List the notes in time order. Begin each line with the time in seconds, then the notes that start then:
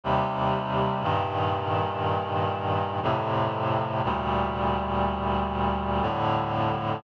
0.04 D#2 C3 G3
1.02 G2 A#2 D#3
3.03 F2 A2 C3
4.04 D2 A#2 G3
6.02 F2 A2 D3